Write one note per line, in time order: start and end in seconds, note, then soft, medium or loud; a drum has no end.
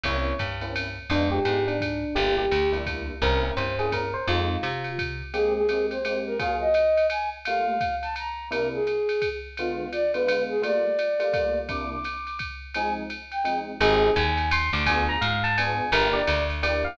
0.03 0.33 C2 medium
0.03 0.32 A#3 medium
0.03 0.32 C4 medium
0.03 0.32 C#4 medium
0.03 0.32 E4 medium
0.03 0.35 C#5 medium
0.03 kick medium
0.03 ride loud
0.39 0.99 G2 medium
0.39 kick medium
0.39 hi-hat pedal medium
0.39 ride medium
0.61 0.84 A#3 medium
0.61 0.84 C4 medium
0.61 0.84 C#4 medium
0.61 0.84 E4 medium
0.61 ride medium
0.76 ride loud
1.10 1.39 F2 loud
1.10 1.38 G#3 medium
1.10 1.38 B3 medium
1.10 1.38 D4 medium
1.10 1.29 D4 loud
1.10 1.38 F4 medium
1.10 ride loud
1.31 1.63 G4 medium
1.45 2.05 G#2 medium
1.45 1.73 G#3 medium
1.45 1.73 B3 medium
1.45 1.73 D4 medium
1.45 1.73 F4 medium
1.45 hi-hat pedal medium
1.45 ride medium
1.67 2.16 D4 medium
1.67 ride medium
1.81 kick medium
1.81 ride loud
2.15 2.46 G1 loud
2.15 2.45 G3 medium
2.15 2.45 A#3 medium
2.15 2.45 D4 medium
2.15 2.45 E4 medium
2.15 2.35 G4 medium
2.15 ride loud
2.38 2.70 G4 medium
2.51 3.11 D2 medium
2.51 hi-hat pedal medium
2.51 ride loud
2.72 2.82 G3 medium
2.72 2.82 A#3 medium
2.72 2.82 D4 medium
2.72 2.82 E4 medium
2.72 ride medium
2.86 3.14 G3 medium
2.86 3.14 A#3 medium
2.86 3.14 D4 medium
2.86 3.14 E4 medium
2.86 kick medium
2.86 ride loud
3.22 3.51 C2 loud
3.22 3.37 A#3 medium
3.22 3.37 C4 medium
3.22 3.37 C#4 medium
3.22 3.37 E4 medium
3.22 3.41 A#4 loud
3.22 kick medium
3.22 ride loud
3.42 3.65 A#3 medium
3.42 3.65 C4 medium
3.42 3.65 C#4 medium
3.42 3.65 E4 medium
3.57 4.16 G2 medium
3.57 3.75 C5 medium
3.57 hi-hat pedal medium
3.57 ride medium
3.79 4.01 A#3 medium
3.79 4.01 C4 medium
3.79 4.01 C#4 medium
3.79 4.01 E4 medium
3.79 3.91 G#4 medium
3.79 ride medium
3.92 4.13 A#4 medium
3.92 kick medium
3.92 ride loud
4.14 4.27 C5 medium
4.27 4.57 F2 loud
4.27 4.55 G#3 medium
4.27 4.55 C4 medium
4.27 4.55 D#4 medium
4.27 4.55 F4 medium
4.27 4.89 F4 loud
4.27 ride loud
4.63 5.22 C3 medium
4.63 hi-hat pedal medium
4.63 ride loud
4.84 ride medium
4.99 kick medium
4.99 ride loud
5.33 5.61 G#3 medium
5.33 5.61 A#3 medium
5.33 5.61 C4 medium
5.33 5.61 G4 medium
5.33 5.53 G#4 medium
5.33 ride loud
5.55 5.86 G#4 medium
5.69 5.97 G#3 medium
5.69 5.97 A#3 medium
5.69 5.97 C4 medium
5.69 5.97 G4 medium
5.69 hi-hat pedal medium
5.69 ride loud
5.90 6.19 C5 medium
5.90 ride medium
6.05 6.32 G#3 medium
6.05 6.32 A#3 medium
6.05 6.32 C4 medium
6.05 6.32 G4 medium
6.05 ride loud
6.26 6.38 A#4 medium
6.39 6.66 F#3 medium
6.39 6.66 A#3 medium
6.39 6.66 F4 medium
6.39 6.66 G#4 medium
6.39 6.56 F5 medium
6.39 kick medium
6.39 ride loud
6.60 7.06 D#5 medium
6.74 hi-hat pedal medium
6.74 ride loud
6.97 ride medium
7.10 7.30 G#5 medium
7.10 ride loud
7.45 7.74 G3 medium
7.45 7.74 A3 medium
7.45 7.74 A#3 medium
7.45 7.74 F4 medium
7.45 7.95 F5 medium
7.45 ride loud
7.81 kick medium
7.81 hi-hat pedal medium
7.81 ride loud
8.02 8.15 A5 medium
8.02 ride medium
8.16 8.48 A#5 medium
8.16 ride loud
8.51 8.78 C3 medium
8.51 8.78 A#3 medium
8.51 8.78 D4 medium
8.51 8.78 E4 medium
8.51 8.69 A#4 medium
8.51 ride loud
8.73 9.29 G#4 medium
8.87 hi-hat pedal medium
8.87 ride medium
9.09 ride medium
9.22 kick medium
9.22 ride loud
9.57 9.86 D3 medium
9.57 9.86 G#3 medium
9.57 9.86 B3 medium
9.57 9.91 F4 medium
9.57 9.86 F4 medium
9.57 ride loud
9.92 10.12 D5 medium
9.92 hi-hat pedal medium
9.92 ride medium
10.14 10.24 D3 medium
10.14 10.24 G#3 medium
10.14 10.24 B3 medium
10.14 10.24 F4 medium
10.14 10.43 B4 medium
10.14 ride medium
10.27 10.54 D3 medium
10.27 10.54 G#3 medium
10.27 10.54 B3 medium
10.27 10.54 F4 medium
10.27 ride loud
10.49 10.62 G#4 medium
10.62 10.89 G3 medium
10.62 10.89 A3 medium
10.62 10.89 A#3 medium
10.62 10.89 F4 medium
10.62 11.59 D5 medium
10.62 ride loud
10.99 hi-hat pedal loud
10.99 ride medium
11.19 11.29 G3 medium
11.19 11.29 A3 medium
11.19 11.29 A#3 medium
11.19 11.29 F4 medium
11.19 ride medium
11.33 11.60 G3 medium
11.33 11.60 A3 medium
11.33 11.60 A#3 medium
11.33 11.60 F4 medium
11.33 kick medium
11.33 ride loud
11.69 11.96 C3 medium
11.69 11.96 A#3 medium
11.69 11.96 D4 medium
11.69 11.96 E4 medium
11.69 11.90 D6 medium
11.69 kick medium
11.69 ride loud
11.91 12.39 D6 medium
12.04 hi-hat pedal medium
12.04 ride loud
12.27 ride medium
12.39 kick medium
12.39 ride loud
12.74 13.02 F3 medium
12.74 13.02 G#3 medium
12.74 13.02 C4 medium
12.74 13.02 D#4 medium
12.74 12.94 G#5 medium
12.74 ride loud
13.10 hi-hat pedal medium
13.10 ride medium
13.32 13.59 G5 medium
13.32 ride medium
13.44 13.71 F3 medium
13.44 13.71 G#3 medium
13.44 13.71 C4 medium
13.44 13.71 D#4 medium
13.44 ride loud
13.80 14.10 G#1 loud
13.80 14.08 C4 medium
13.80 14.08 D#4 loud
13.80 14.08 G4 medium
13.80 14.12 G#4 loud
13.80 14.08 G#4 medium
13.80 ride loud
14.16 14.70 D#2 loud
14.16 14.49 G#5 loud
14.16 hi-hat pedal loud
14.16 ride loud
14.37 ride medium
14.51 14.70 C6 medium
14.51 ride loud
14.73 15.16 D2 loud
14.73 14.84 D6 medium
14.86 15.15 B3 medium
14.86 15.15 D4 medium
14.86 15.15 F4 medium
14.86 15.15 G#4 medium
14.86 15.04 G#5 loud
14.86 kick medium
14.86 ride loud
15.09 15.21 A#5 medium
15.21 15.81 G#2 loud
15.21 15.42 F5 medium
15.21 hi-hat pedal loud
15.21 ride loud
15.44 15.57 A5 loud
15.44 ride medium
15.57 15.85 B3 medium
15.57 15.85 D4 medium
15.57 15.85 F4 medium
15.57 15.85 G#4 medium
15.57 15.90 G#5 medium
15.57 ride loud
15.92 16.22 G1 loud
15.92 16.20 A#3 medium
15.92 16.20 D4 medium
15.92 16.20 E4 medium
15.92 16.20 G4 medium
15.92 16.14 A#4 loud
15.92 ride loud
16.13 16.44 D5 medium
16.27 16.87 D2 loud
16.27 hi-hat pedal loud
16.27 ride loud
16.50 ride medium
16.62 16.90 A#3 medium
16.62 16.90 D4 medium
16.62 16.90 E4 medium
16.62 16.90 G4 medium
16.62 16.82 D5 medium
16.62 ride loud
16.84 16.97 F5 medium